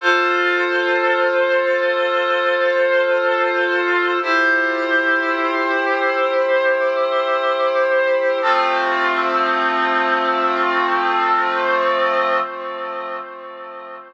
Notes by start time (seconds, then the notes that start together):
0.01 F4 A4 C5
4.21 E4 G4 C5
8.41 F3 A3 C4